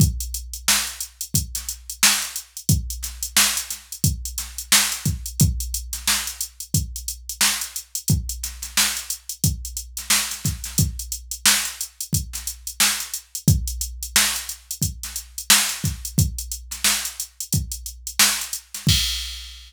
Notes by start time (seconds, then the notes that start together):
0.00 kick, closed hi-hat
0.20 closed hi-hat
0.34 closed hi-hat
0.54 closed hi-hat
0.68 snare
0.87 closed hi-hat
1.00 closed hi-hat
1.21 closed hi-hat
1.34 kick, closed hi-hat
1.55 snare, closed hi-hat
1.69 closed hi-hat
1.90 closed hi-hat
2.03 snare
2.22 closed hi-hat
2.36 closed hi-hat
2.57 closed hi-hat
2.69 kick, closed hi-hat
2.90 closed hi-hat
3.03 snare, closed hi-hat
3.23 closed hi-hat
3.37 snare
3.57 closed hi-hat
3.70 snare, closed hi-hat
3.92 closed hi-hat
4.04 kick, closed hi-hat
4.25 closed hi-hat
4.38 snare, closed hi-hat
4.58 closed hi-hat
4.72 snare
4.92 closed hi-hat
5.05 kick, closed hi-hat
5.26 closed hi-hat
5.40 kick, closed hi-hat
5.60 closed hi-hat
5.74 closed hi-hat
5.93 snare, closed hi-hat
6.07 snare
6.27 closed hi-hat
6.41 closed hi-hat
6.60 closed hi-hat
6.74 kick, closed hi-hat
6.96 closed hi-hat
7.08 closed hi-hat
7.29 closed hi-hat
7.41 snare
7.61 closed hi-hat
7.76 closed hi-hat
7.95 closed hi-hat
8.08 kick, closed hi-hat
8.29 closed hi-hat
8.43 snare, closed hi-hat
8.62 snare, closed hi-hat
8.77 snare
8.97 closed hi-hat
9.10 closed hi-hat
9.29 closed hi-hat
9.44 kick, closed hi-hat
9.65 closed hi-hat
9.77 closed hi-hat
9.97 snare, closed hi-hat
10.10 snare
10.31 snare, closed hi-hat
10.45 kick, snare, closed hi-hat
10.64 snare, closed hi-hat
10.78 kick, closed hi-hat
10.99 closed hi-hat
11.12 closed hi-hat
11.31 closed hi-hat
11.46 snare
11.65 closed hi-hat
11.81 closed hi-hat
12.01 closed hi-hat
12.13 kick, closed hi-hat
12.33 snare, closed hi-hat
12.47 closed hi-hat
12.67 closed hi-hat
12.80 snare
13.00 closed hi-hat
13.14 closed hi-hat
13.35 closed hi-hat
13.48 kick, closed hi-hat
13.68 closed hi-hat
13.81 closed hi-hat
14.03 closed hi-hat
14.16 snare
14.36 closed hi-hat
14.49 closed hi-hat
14.71 closed hi-hat
14.82 kick, closed hi-hat
15.03 snare, closed hi-hat
15.16 closed hi-hat
15.38 closed hi-hat
15.50 snare
15.69 closed hi-hat
15.84 kick, snare, closed hi-hat
16.05 closed hi-hat
16.18 kick, closed hi-hat
16.38 closed hi-hat
16.52 closed hi-hat
16.71 snare, closed hi-hat
16.84 snare
17.05 closed hi-hat
17.20 closed hi-hat
17.40 closed hi-hat
17.53 kick, closed hi-hat
17.72 closed hi-hat
17.86 closed hi-hat
18.07 closed hi-hat
18.19 snare
18.41 closed hi-hat
18.53 closed hi-hat
18.74 snare, closed hi-hat
18.87 kick, crash